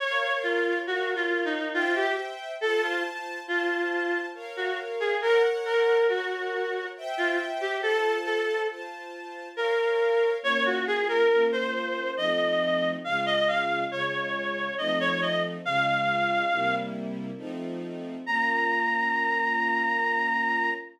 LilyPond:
<<
  \new Staff \with { instrumentName = "Clarinet" } { \time 3/4 \key bes \minor \tempo 4 = 69 des''8 f'8 \tuplet 3/2 { ges'8 f'8 ees'8 } f'16 g'16 r8 | a'16 f'16 r8 f'4 r16 ges'16 r16 aes'16 | bes'16 r16 bes'8 ges'4 r16 f'16 r16 g'16 | a'8 a'8 r4 bes'4 |
des''16 ges'16 aes'16 bes'8 c''8. ees''4 | f''16 ees''16 f''8 des''4 ees''16 des''16 ees''16 r16 | f''4. r4. | bes''2. | }
  \new Staff \with { instrumentName = "String Ensemble 1" } { \time 3/4 \key bes \minor <bes' des'' f''>4 <bes' des'' f''>4 <c'' e'' g''>4 | <f' c'' a''>4 <f' c'' a''>4 <bes' des'' f''>4 | <bes' des'' ges''>4 <bes' des'' ges''>4 <c'' e'' g''>4 | <f' c'' a''>4 <f' c'' a''>4 <bes' des'' f''>4 |
<bes des' f'>4 <bes des' f'>4 <f a c' ees'>4 | <des aes f'>4 <des aes f'>4 <f a c' ees'>4 | <des aes f'>4 <c g bes e'>4 <f a c' ees'>4 | <bes des' f'>2. | }
>>